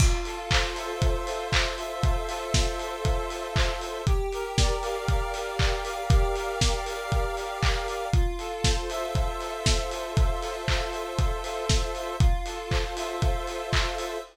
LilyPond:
<<
  \new Staff \with { instrumentName = "Lead 1 (square)" } { \time 4/4 \key f \major \tempo 4 = 118 f'8 a'8 c''8 e''8 f'8 a'8 c''8 e''8 | f'8 a'8 c''8 e''8 f'8 a'8 c''8 e''8 | g'8 bes'8 d''8 f''8 g'8 bes'8 d''8 f''8 | g'8 bes'8 d''8 f''8 g'8 bes'8 d''8 f''8 |
f'8 a'8 c''8 e''8 f'8 a'8 c''8 e''8 | f'8 a'8 c''8 e''8 f'8 a'8 c''8 e''8 | f'8 a'8 c''8 e''8 f'8 a'8 c''8 e''8 | }
  \new DrumStaff \with { instrumentName = "Drums" } \drummode { \time 4/4 <cymc bd>8 hho8 <hc bd>8 hho8 <hh bd>8 hho8 <hc bd>8 hho8 | <hh bd>8 hho8 <bd sn>8 hho8 <hh bd>8 hho8 <hc bd>8 hho8 | <hh bd>8 hho8 <bd sn>8 hho8 <hh bd>8 hho8 <hc bd>8 hho8 | <hh bd>8 hho8 <bd sn>8 hho8 <hh bd>8 hho8 <hc bd>8 hho8 |
<hh bd>8 hho8 <bd sn>8 hho8 <hh bd>8 hho8 <bd sn>8 hho8 | <hh bd>8 hho8 <hc bd>8 hho8 <hh bd>8 hho8 <bd sn>8 hho8 | <hh bd>8 hho8 <hc bd>8 hho8 <hh bd>8 hho8 <hc bd>8 hho8 | }
>>